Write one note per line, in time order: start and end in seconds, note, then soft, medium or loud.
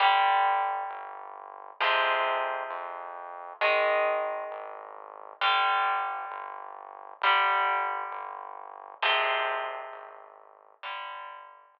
0.00 0.84 G1 medium
0.00 1.76 D3 medium
0.00 1.76 G3 medium
0.89 1.72 G1 medium
1.80 2.63 F2 medium
1.80 3.57 C3 medium
1.80 3.57 F3 medium
1.80 3.57 G#3 medium
2.70 3.53 F2 medium
3.61 4.45 G#1 medium
3.61 5.38 D#3 medium
3.61 5.38 G#3 medium
4.50 5.33 G#1 medium
5.41 6.25 G1 medium
5.41 7.18 D3 medium
5.41 7.18 G3 medium
6.31 7.14 G1 medium
7.21 8.04 G1 medium
7.21 9.00 D3 medium
7.21 9.00 G3 medium
8.11 8.94 G1 medium
9.02 9.85 G#1 medium
9.02 10.79 C3 medium
9.02 10.79 F3 medium
9.02 10.79 G#3 medium
9.92 10.75 G#1 medium
10.83 11.67 G1 medium
10.83 11.79 D3 medium
10.83 11.79 G3 medium
11.73 11.79 G1 medium